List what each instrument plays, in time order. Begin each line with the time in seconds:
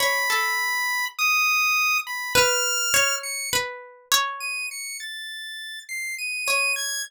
0.00 pizzicato strings C#5, lead 1 (square) B5
0.30 pizzicato strings A4
1.19 lead 1 (square) D#6
2.07 lead 1 (square) B5
2.35 pizzicato strings B4, lead 1 (square) F6
2.94 pizzicato strings C#5
3.23 lead 1 (square) C#7
3.53 pizzicato strings B4
4.12 pizzicato strings C#5
4.40 lead 1 (square) D#7
4.71 lead 1 (square) C#7
5.00 lead 1 (square) A6
5.89 lead 1 (square) C7
6.18 lead 1 (square) D#7
6.46 pizzicato strings C#5, lead 1 (square) D#7
6.76 lead 1 (square) G#6